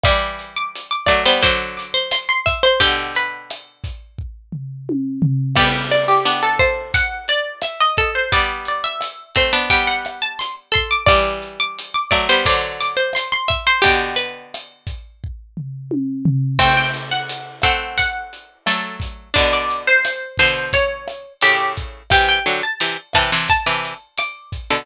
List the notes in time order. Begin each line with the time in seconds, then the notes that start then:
0.03 E3 G3 D5 D6, kick, cross-stick, closed hi-hat
0.39 closed hi-hat
0.56 D6
0.75 closed hi-hat
0.91 D6
1.06 F#3 A3 D5, kick, cross-stick, closed hi-hat
1.25 G3 B3 C5
1.41 D3 F#3 C5 D6, kick, closed hi-hat
1.77 D6, closed hi-hat
1.94 C5
2.11 C6, cross-stick, closed hi-hat
2.29 C6
2.46 E5, kick, closed hi-hat
2.63 C5 C6
2.80 B2 D3 G4 G5, kick, closed hi-hat
3.15 B4, closed hi-hat
3.50 cross-stick, closed hi-hat
3.84 kick, closed hi-hat
4.18 kick
4.52 floor tom
4.89 high tom
5.22 floor tom
5.55 G3 B3 G4 D5, kick, cross-stick, crash
5.90 D5, closed hi-hat
6.08 G4
6.25 B3 D4, closed hi-hat
6.43 A4
6.59 C5, kick, cross-stick, closed hi-hat
6.94 F#5, kick, closed hi-hat
7.28 D5, closed hi-hat
7.61 E5, cross-stick, closed hi-hat
7.80 D#5
7.97 A4, kick, closed hi-hat
8.15 C5
8.32 G3 B3 D5, kick, closed hi-hat
8.65 D5, closed hi-hat
8.84 E5
9.01 cross-stick, closed hi-hat
9.35 A3 C4 C5, kick, closed hi-hat
9.53 B3 D4
9.70 G3 B3 G5, kick, closed hi-hat
9.87 F#5
10.05 cross-stick, closed hi-hat
10.22 A5
10.39 C6, closed hi-hat
10.72 A4 C6, kick, closed hi-hat
10.91 D6
11.06 E3 G3 D5 D6, kick, cross-stick, closed hi-hat
11.42 closed hi-hat
11.60 D6
11.78 closed hi-hat
11.94 D6
12.11 F#3 A3 D5, kick, cross-stick, closed hi-hat
12.29 G3 B3 C5
12.45 D3 F#3 C5 D6, kick, closed hi-hat
12.80 D6, closed hi-hat
12.97 C5
13.13 C6, cross-stick, closed hi-hat
13.32 C6
13.48 E5, kick, closed hi-hat
13.67 C5 C6
13.82 B2 D3 G4 G5, kick, closed hi-hat
14.16 B4, closed hi-hat
14.54 cross-stick, closed hi-hat
14.87 kick, closed hi-hat
15.24 kick
15.57 floor tom
15.91 high tom
16.25 floor tom
16.59 A3 C4 G5, kick, cross-stick, crash
16.77 G5
16.94 closed hi-hat
17.11 F#5
17.29 closed hi-hat
17.62 A3 C4 F#5, kick, cross-stick, closed hi-hat
17.98 F#5, kick, closed hi-hat
18.33 closed hi-hat
18.66 F#3 A3 A4, cross-stick, closed hi-hat
19.00 kick, closed hi-hat
19.34 B2 D3 D4 D5, kick, closed hi-hat
19.53 D5
19.70 closed hi-hat
19.87 C5
20.05 cross-stick, closed hi-hat
20.37 B2 D3 C5, kick, closed hi-hat
20.73 C#5, kick, closed hi-hat
21.08 cross-stick, closed hi-hat
21.41 A2 C#3 G4, closed hi-hat
21.77 kick, closed hi-hat
22.10 C3 E3 G4 G5, kick, cross-stick, closed hi-hat
22.29 G5
22.46 D3 F#3, closed hi-hat
22.63 A5
22.80 C3 E3, closed hi-hat
23.13 C3 E3 A5, kick, cross-stick, closed hi-hat
23.32 C3 E3
23.48 A5, kick, closed hi-hat
23.66 C3 E3
23.85 closed hi-hat
24.18 D6, cross-stick, closed hi-hat
24.52 kick, closed hi-hat
24.70 B2 D3